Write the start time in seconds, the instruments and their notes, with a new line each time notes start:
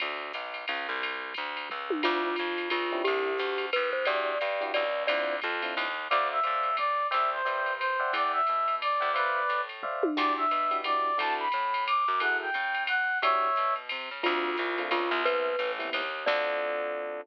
0.00 electric bass (finger) D2, kick, ride
0.33 electric bass (finger) B1, hi-hat pedal, ride
0.54 ride
0.68 electric bass (finger) C#2, ride
0.89 electric bass (finger) C2
1.02 kick, ride
1.34 electric bass (finger) D2, kick, hi-hat pedal, ride
1.57 ride
1.69 electric bass (finger) C#2, kick, floor tom, ride
1.90 high tom
2.03 electric bass (finger) D2, electric piano 1 C4 D4 E4 F4, glockenspiel F4, crash, ride
2.36 electric bass (finger) F2, hi-hat pedal, ride
2.58 ride
2.70 electric bass (finger) C#2, glockenspiel F4, ride
2.92 electric piano 1 C4 D4 E4 G4
3.04 electric bass (finger) C2, glockenspiel G4, ride
3.38 electric bass (finger) D2, hi-hat pedal, ride
3.58 ride
3.73 electric bass (finger) D#2, glockenspiel B4, kick, ride
3.93 glockenspiel C5
4.05 electric bass (finger) E2, electric piano 1 D4 E4 F#4 G4, glockenspiel D5, ride
4.41 electric bass (finger) G2, hi-hat pedal, ride
4.61 electric piano 1 D4 E4 F#4 G4, ride
4.74 electric bass (finger) C#2, glockenspiel D5, ride
5.07 electric bass (finger) D2, electric piano 1 C4 D4 E4 F4, glockenspiel D5, ride
5.42 electric bass (finger) F2, kick, hi-hat pedal, ride
5.62 electric piano 1 C4 D4 E4 F4, ride
5.76 electric bass (finger) D#2, kick, ride
6.09 electric bass (finger) D2, electric piano 1 C5 D5 E5 F5, brass section D5, ride
6.32 brass section E5
6.43 electric bass (finger) A2, electric piano 1 C5 D5 E5 F5, hi-hat pedal, ride
6.63 ride
6.77 brass section D5, kick, ride
7.11 electric bass (finger) C2, electric piano 1 C5 D5 E5 G5, brass section E5, ride
7.32 brass section C5
7.45 electric bass (finger) G2, electric piano 1 C5 D5 E5 G5, hi-hat pedal, ride
7.66 ride
7.78 brass section C5, ride
8.00 electric piano 1 D5 E5 F#5 G5
8.13 electric bass (finger) E2, brass section D5, kick, ride
8.33 brass section E5
8.47 electric bass (finger) B2, hi-hat pedal, ride
8.68 ride
8.81 brass section D5, ride
9.00 electric bass (finger) D2, electric piano 1 D5 E5 F#5 G5
9.14 brass section B4 D5, electric piano 1 C5 D5 E5 F5, ride
9.49 electric bass (finger) A2, hi-hat pedal, ride
9.69 ride
9.83 electric piano 1 C5 D5 E5 F5, kick, floor tom
10.03 high tom
10.17 electric bass (finger) E2, electric piano 1 D4 E4 F#4 G4, brass section D5, kick, crash, ride
10.37 brass section E5
10.51 electric bass (finger) B2, hi-hat pedal, ride
10.71 electric piano 1 D4 E4 F#4 G4, ride
10.84 electric piano 1 D4 E4 F#4 G4, brass section D5, ride
11.18 electric bass (finger) D2, electric piano 1 D4 E4 F#4 A4, brass section A5, ride
11.39 brass section B5
11.52 electric bass (finger) A2, hi-hat pedal, ride
11.74 ride
11.87 brass section D6, ride
12.08 electric bass (finger) F#2
12.20 electric piano 1 E4 F#4 G#4 A4, brass section F#5, ride
12.41 brass section G5
12.54 electric bass (finger) C#3, kick, hi-hat pedal, ride
12.75 ride
12.87 brass section F#5, ride
13.22 electric bass (finger) E2, electric piano 1 D4 E4 F#4 G4, brass section C#5 E5, ride
13.56 electric bass (finger) B2, hi-hat pedal, ride
13.76 ride
13.89 electric bass (finger) C3, ride
14.11 electric bass (finger) C#3
14.23 electric bass (finger) D2, electric piano 1 A3 C4 D4 F4, glockenspiel F4, kick, ride
14.57 electric bass (finger) C2, hi-hat pedal, ride
14.78 electric piano 1 A3 C4 D4 F4, ride
14.91 electric bass (finger) C#2, glockenspiel F4, kick, ride
15.11 electric bass (finger) C2
15.25 electric piano 1 G3 B3 C4 E4, glockenspiel B4, kick, ride
15.59 electric bass (finger) A1, hi-hat pedal, ride
15.79 electric piano 1 G3 B3 C4 E4, ride
15.93 electric bass (finger) D#2, ride
16.26 electric bass (finger) D2, electric piano 1 C4 D4 F4 A4, glockenspiel D5, kick, crash